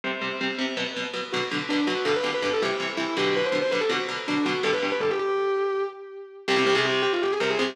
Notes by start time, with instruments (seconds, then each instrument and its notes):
0.04 overdriven guitar C3 G3 C4
0.21 overdriven guitar C3 G3 C4
0.41 overdriven guitar C3 G3 C4
0.59 overdriven guitar C3 G3 C4
0.77 overdriven guitar B2 F#3 B3
0.96 overdriven guitar B2 F#3 B3
1.14 overdriven guitar B2 F#3 B3
1.33 overdriven guitar B2 D3 F#3, distortion guitar F#4
1.51 overdriven guitar B2 D3 F#3
1.69 overdriven guitar B2 D3 F#3, distortion guitar D4
1.87 overdriven guitar B2 D3 F#3, distortion guitar F#4
2.05 overdriven guitar G2 B2 D3, distortion guitar A4
2.16 distortion guitar B4
2.23 overdriven guitar G2 B2 D3
2.34 distortion guitar B4
2.42 overdriven guitar G2 B2 D3, distortion guitar B4
2.53 distortion guitar A4
2.62 overdriven guitar C3 E3 G3, distortion guitar G4
2.80 overdriven guitar C3 E3 G3
2.97 overdriven guitar C3 E3 G3, distortion guitar E4
3.17 overdriven guitar B2 D3 F#3, distortion guitar G4
3.36 distortion guitar B4
3.45 distortion guitar C5
3.52 overdriven guitar B2 D3 F#3
3.62 distortion guitar C5
3.71 overdriven guitar B2 D3 F#3, distortion guitar B4
3.81 distortion guitar A4
3.89 overdriven guitar B2 D3 F#3, distortion guitar F#4
4.09 overdriven guitar B2 D3 F#3
4.28 overdriven guitar B2 D3 F#3, distortion guitar D4
4.45 overdriven guitar B2 D3 F#3, distortion guitar F#4
4.63 overdriven guitar G2 B2 D3, distortion guitar A4
4.73 distortion guitar B4
4.82 overdriven guitar G2 B2 D3
4.92 distortion guitar B4
5.00 overdriven guitar G2 B2 D3, distortion guitar A4
5.10 distortion guitar G4
5.19 distortion guitar G4
6.48 overdriven guitar C2 C3 G3, distortion guitar G4
6.56 overdriven guitar C2 C3 G3, distortion guitar G4
6.66 overdriven guitar C2 C3 G3
6.75 overdriven guitar C2 C3 G3, distortion guitar G#4
6.85 distortion guitar G4
7.02 distortion guitar G4
7.13 distortion guitar F4
7.22 distortion guitar G4
7.31 distortion guitar G#4
7.40 overdriven guitar C2 C3 G3, distortion guitar A#4
7.50 distortion guitar G#4
7.59 overdriven guitar C2 C3 G3, distortion guitar G#4
7.68 distortion guitar G4